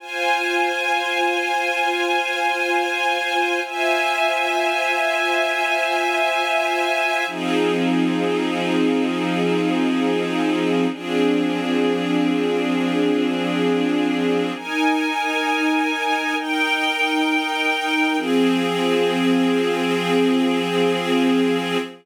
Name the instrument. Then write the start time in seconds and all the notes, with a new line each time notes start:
string ensemble 1
0.00 F4 C5 G#5
3.65 F4 C5 E5 G#5
7.27 F3 C4 D#4 G#4
10.91 F3 C4 D4 G#4
14.54 D#4 A#4 G#5
16.37 D#4 A#4 G5
18.17 F3 C4 G#4